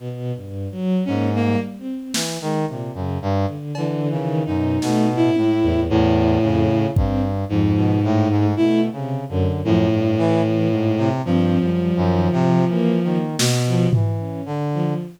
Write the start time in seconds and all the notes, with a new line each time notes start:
0.00 B2
0.36 G2
0.72 F#3
1.05 G#2 A#3 C#4
1.35 A#3
1.43 G3
1.79 C4
2.14 E3, snare
2.41 D#3 G#3
2.68 A#2 C3
2.94 F#2 C#3
3.22 G2
3.48 D3
3.75 D3 E3, cowbell
4.11 C#3 D#3
4.45 F#2 B2 D#4
4.82 B2 A3, snare
5.09 A2
5.16 E4
5.36 A2, high tom
5.63 E2
5.90 E2 A2
6.42 F2 C#3
6.96 G2 C4, kick
7.49 F2 G#2 F3
7.76 B2
8.03 A2 A3
8.30 G#2
8.57 B2 A3 E4
8.92 C3 C#3
9.29 F#2 D3
9.64 F#2 A2 F3
9.92 G2
10.18 E3
10.44 E3
10.72 G#2
10.98 C3
11.25 G2 F3 C4
11.60 F#2 G3
11.96 F#2 D#3
12.32 C3 F3, floor tom
12.68 E3 A#3
13.03 D#3 A#3
13.39 B2, snare
13.66 F3
13.93 E3, floor tom
14.20 C#4
14.46 D3
14.74 F3